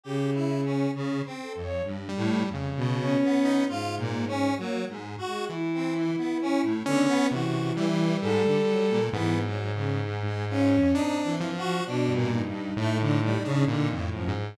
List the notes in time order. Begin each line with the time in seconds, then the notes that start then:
0.03 C#3 G4
0.34 E4
0.64 C#4
0.95 C#3
1.25 C4
1.42 A4
1.55 F2
1.63 C#5
1.84 G2
2.09 G3
2.16 A2
2.47 F2
2.54 C#3
2.77 B2
3.00 C#4
3.23 B3
3.45 D#4
3.68 G#2 F4
3.98 A#2
4.27 C#4
4.58 F#3 A#3
4.89 G#2
5.18 F#4
5.27 G#3
5.49 E3 E4
5.74 C4
5.96 E3
6.17 B3
6.41 C#4
6.63 A2
6.86 D3 B3 C#4
7.07 B3
7.30 C3 E3 F#4
7.76 E3 G3
8.21 G#2 A4
8.45 D3
8.67 F#3
8.89 A#2
9.12 G#2 E3 B3
9.44 F#3
9.74 C#3
10.02 G#2
10.25 G#3
10.49 C#4 F4
10.74 F2
10.94 C4 D4 D#4
11.24 E3
11.40 F3
11.57 F#4
11.63 F3
11.86 B2 D4
12.09 G2
12.14 A#2
12.31 D#4
12.47 G2
12.77 A2 A3
13.00 D3
13.23 G3
13.45 C#3 D4
13.67 A#2 D3
13.89 F2
13.98 A2
14.12 F#2 F3
14.28 G#2